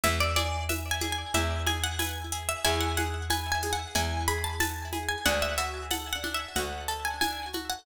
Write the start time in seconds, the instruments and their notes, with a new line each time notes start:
0.03 electric bass (finger) E2, pizzicato strings E4 E5, low conga, shaker
0.20 pizzicato strings D5
0.36 pizzicato strings G#4 D5, high conga, shaker
0.69 pizzicato strings B4 E5, tambourine, high conga, shaker
0.91 pizzicato strings G#5
1.01 pizzicato strings G#4, high conga, shaker
1.12 pizzicato strings G#5
1.34 electric bass (finger) E2, pizzicato strings E4 E5, low conga, shaker
1.66 pizzicato strings G#4 G#5, high conga, shaker
1.84 pizzicato strings F#5
1.99 pizzicato strings B4 G#5, tambourine, high conga, shaker
2.32 pizzicato strings G#4, shaker
2.49 pizzicato strings E5
2.64 electric bass (finger) E2, pizzicato strings E4 G#5, shaker
2.80 pizzicato strings F#5
2.97 pizzicato strings G#4 F#5, high conga, shaker
3.30 pizzicato strings B4 G#5, tambourine, high conga, shaker
3.52 pizzicato strings G#5
3.62 pizzicato strings G#4, high conga, shaker
3.73 pizzicato strings F#5
3.95 electric bass (finger) E2, pizzicato strings E4 G#5, low conga, shaker
4.28 pizzicato strings G#4 B5, shaker
4.44 pizzicato strings A5
4.60 pizzicato strings B4 A5, tambourine, high conga, shaker
4.93 pizzicato strings G#4, high conga, shaker
5.08 pizzicato strings G#5
5.25 electric bass (finger) D2, pizzicato strings D4 F#5, low conga, shaker
5.42 pizzicato strings E5
5.58 pizzicato strings F#4 E5, shaker
5.90 pizzicato strings A4 F#5, tambourine, high conga, shaker
6.13 pizzicato strings F#5
6.23 pizzicato strings D4, high conga, shaker
6.34 pizzicato strings E5
6.56 electric bass (finger) D2, pizzicato strings F#4 F#5, low conga, shaker
6.88 pizzicato strings A4 A5, shaker
7.05 pizzicato strings G#5
7.21 pizzicato strings D4 G#5, tambourine, high conga, shaker
7.53 pizzicato strings F#4, high conga, shaker
7.70 pizzicato strings F#5